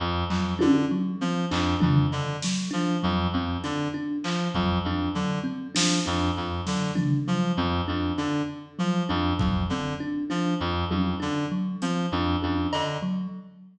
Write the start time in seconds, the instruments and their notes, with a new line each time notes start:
0.00 clarinet F2
0.30 clarinet F2, kalimba F#3, clap
0.59 clarinet D3, kalimba D4, high tom
0.91 kalimba F#3
1.21 clarinet F3, kalimba C4
1.51 clarinet F2, kalimba D4, clap
1.80 clarinet F2, kalimba D4, floor tom
2.12 clarinet D3, cowbell
2.42 kalimba F#3, snare
2.71 clarinet F3, kalimba D4
3.03 clarinet F2, kalimba F#3
3.33 clarinet F2, kalimba C4
3.64 clarinet D3, kalimba D4, closed hi-hat
3.94 kalimba D4
4.24 clarinet F3, clap
4.54 clarinet F2, kalimba F#3, kick
4.84 clarinet F2, kalimba D4
5.15 clarinet D3, kalimba F#3
5.44 kalimba C4
5.75 clarinet F3, kalimba D4, snare
6.06 clarinet F2, kalimba D4
6.37 clarinet F2
6.67 clarinet D3, kalimba F#3, snare
6.95 kalimba D4, floor tom
7.28 clarinet F3, kalimba F#3
7.57 clarinet F2, kalimba C4
7.88 clarinet F2, kalimba D4
8.18 clarinet D3, kalimba D4
8.79 clarinet F3, kalimba F#3
9.09 clarinet F2, kalimba D4
9.39 clarinet F2, kalimba F#3, kick
9.70 clarinet D3, kalimba C4
10.00 kalimba D4
10.30 clarinet F3, kalimba D4
10.60 clarinet F2
10.91 clarinet F2, kalimba F#3, high tom
11.20 clarinet D3, kalimba D4
11.52 kalimba F#3
11.82 clarinet F3, kalimba C4, closed hi-hat
12.12 clarinet F2, kalimba D4
12.42 clarinet F2, kalimba D4, high tom
12.73 clarinet D3, cowbell
13.02 kalimba F#3